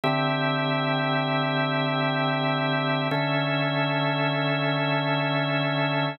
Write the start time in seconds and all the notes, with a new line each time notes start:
0.04 D3 C4 G4 E5
3.11 D3 C#4 A4 E5